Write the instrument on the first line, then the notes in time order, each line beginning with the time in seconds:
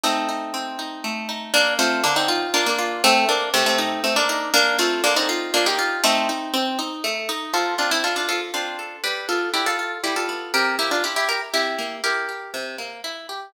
acoustic guitar (steel)
0.04 A3 C4 D#4
0.29 D#4
0.54 C4
0.79 D#4
1.04 A3
1.29 D#4
1.54 A#3 D4
1.79 A3 C4 F4
2.04 D3 A#3 D4
2.16 C4 D#4
2.28 F4
2.54 A#3 D4 F4
2.66 A#3 D4
2.79 F4
3.04 A3 C4
3.29 A#3 D4
3.54 C3 A3 C4
3.66 A3 C4
3.78 D#4
4.04 A3 C4
4.16 A#3 D4
4.29 D#4
4.54 A#3 D4
4.79 A3 C4 F4
5.04 D3 A#3 D4
5.16 C4 D#4
5.29 F4
5.54 A#3 D4 F4
5.66 D#4 G4
5.79 F4
6.04 A3 C4 D#4
6.29 D#4
6.54 C4
6.79 D#4
7.04 A3
7.29 D#4
7.53 F3 F4 A4
7.78 C4 D4 F4
7.91 C4 E4
8.04 D4 F4 A4
8.16 D4 F4
8.29 F3 F4 A4
8.54 C4 D4 F4
8.79 A4
9.04 G3 G4 B4
9.29 B3 F4 A4
9.54 D4 E4 G4
9.66 F4 A4
9.79 F4
10.04 G3 E4 G4
10.16 F4 A4
10.29 B3
10.54 C3 G4 A#4
10.79 A#3 E4 G4
10.91 D4 F4
11.04 E4 G4
11.16 E4 G4
11.29 G4 A#4
11.53 C3 E4 G4
11.79 A#3
12.04 E4 G4 A#4
12.29 G4
12.54 C3
12.78 A#3
13.04 E4
13.29 G4